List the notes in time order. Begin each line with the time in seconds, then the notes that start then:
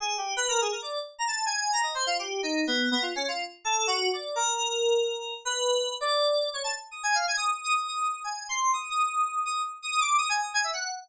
0.00 G#4
0.18 G4
0.37 B4
0.48 A#4
0.61 G#4
0.72 A#4
0.82 D5
1.18 A#5
1.27 A5
1.46 G#5
1.73 A#5
1.83 D#5
1.95 C5
2.06 F4
2.19 G4
2.43 D#4
2.67 B3
2.91 B3
3.02 F4
3.16 C#4
3.28 F4
3.65 A4
3.87 F#4
4.13 D5
4.36 A#4
5.45 B4
6.01 D5
6.53 C#5
6.64 A5
6.91 D#6
7.03 G#5
7.15 F5
7.27 G#5
7.37 D#6
7.46 D#6
7.64 D#6
7.76 D#6
7.88 D#6
8.00 D#6
8.24 G#5
8.49 C6
8.73 D#6
8.90 D#6
9.46 D#6
9.82 D#6
9.91 D#6
10.00 D6
10.18 D#6
10.29 G#5
10.42 D#6
10.54 G#5
10.64 E5
10.73 F#5